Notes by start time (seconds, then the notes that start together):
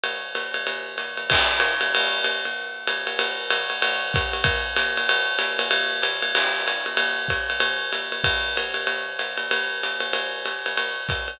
0.04 ride
0.35 hi-hat pedal, ride
0.54 ride
0.67 ride
0.98 hi-hat pedal, ride
1.17 ride
1.30 kick, crash, ride
1.60 hi-hat pedal, ride
1.81 ride
1.95 ride
2.24 hi-hat pedal, ride
2.45 ride
2.87 hi-hat pedal, ride
3.07 ride
3.19 ride
3.50 hi-hat pedal, ride
3.70 ride
3.82 ride
4.14 kick, hi-hat pedal, ride
4.33 ride
4.44 kick, ride
4.76 hi-hat pedal, ride
4.97 ride
5.09 ride
5.39 hi-hat pedal, ride
5.59 ride
5.71 ride
6.02 hi-hat pedal, ride
6.22 ride
6.35 crash, ride
6.67 hi-hat pedal, ride
6.86 ride
6.97 ride
7.28 kick, hi-hat pedal, ride
7.50 ride
7.60 ride
7.93 hi-hat pedal, ride
8.12 ride
8.24 kick, ride
8.56 hi-hat pedal, ride
8.74 ride
8.87 ride
9.19 hi-hat pedal, ride
9.37 ride
9.51 ride
9.83 hi-hat pedal, ride
10.00 ride
10.13 ride
10.46 hi-hat pedal, ride
10.66 ride
10.77 ride
11.09 kick, hi-hat pedal, ride
11.28 ride